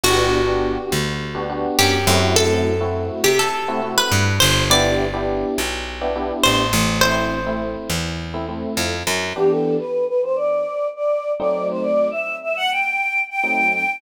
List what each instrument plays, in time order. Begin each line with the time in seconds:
0.04 electric bass (finger) G1, electric piano 1 B3 D4 F#4 G4, acoustic guitar (steel) F#4
0.47 electric piano 1 B3 D4 F#4 G4
0.92 electric bass (finger) D2
1.35 electric piano 1 B3 D4 F#4 G4
1.49 electric piano 1 B3 D4 F#4 G4
1.79 electric bass (finger) F#2, acoustic guitar (steel) G4
2.07 electric bass (finger) F#2, electric piano 1 A3 C4 E4 F#4
2.36 acoustic guitar (steel) A4
2.81 electric piano 1 A3 C4 E4 F#4
3.24 electric bass (finger) C3, acoustic guitar (steel) G4
3.39 acoustic guitar (steel) A4
3.68 electric piano 1 A3 C4 E4 F#4
3.82 electric piano 1 A3 C4 E4 F#4
3.98 acoustic guitar (steel) B4
4.11 electric bass (finger) G2
4.40 electric bass (finger) G1, acoustic guitar (steel) C5
4.70 electric piano 1 B3 D4 E4 G4, acoustic guitar (steel) D5
5.13 electric piano 1 B3 D4 E4 G4
5.58 electric bass (finger) B1
6.01 electric piano 1 B3 D4 E4 G4
6.15 electric piano 1 B3 D4 E4 G4
6.43 electric bass (finger) A1, acoustic guitar (steel) C5
6.73 electric bass (finger) A1
7.01 electric piano 1 A3 C4 E4, acoustic guitar (steel) C5
7.46 electric piano 1 A3 C4 E4
7.90 electric bass (finger) E2
8.34 electric piano 1 A3 C4 E4
8.48 electric piano 1 A3 C4 E4
8.77 electric bass (finger) F2
9.07 electric bass (finger) F#2
9.36 electric piano 1 E3 B3 D4 G4, choir aahs G4
9.50 choir aahs A4
9.79 choir aahs B4
10.08 choir aahs B4
10.23 choir aahs C5
10.36 choir aahs D5
10.96 choir aahs D5
11.39 electric piano 1 F#3 A3 C4 D#4, choir aahs D5
11.70 choir aahs C5
11.82 choir aahs D5
12.11 choir aahs E5
12.43 choir aahs E5
12.56 choir aahs F#5
12.71 choir aahs G5
13.30 choir aahs G5
13.43 electric piano 1 F#3 A3 C4 D#4
13.73 choir aahs G5